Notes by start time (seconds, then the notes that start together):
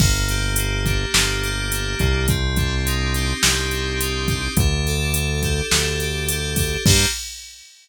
0.00 G1 A#3, kick, crash
0.29 G4, closed hi-hat
0.56 A#3, closed hi-hat
0.85 D4, kick, closed hi-hat
1.14 G1 A#3, snare
1.43 G4, closed hi-hat
1.72 D4, closed hi-hat
1.99 C2 A#3, kick, closed hi-hat
2.28 C4, kick, closed hi-hat
2.56 D4, kick, closed hi-hat
2.86 D#4, closed hi-hat
3.14 G4, closed hi-hat
3.42 C2 C4, snare
3.71 D4, closed hi-hat
4.00 D#4, closed hi-hat
4.28 G4, kick, closed hi-hat
4.57 D2 D4, kick, closed hi-hat
4.87 A4, closed hi-hat
5.14 D4, closed hi-hat
5.43 G4, kick, closed hi-hat
5.71 D2 D4, snare
6.00 A4, closed hi-hat
6.29 G4, closed hi-hat
6.56 D4, kick, open hi-hat
6.86 G2 A#3 D4 G4, kick, crash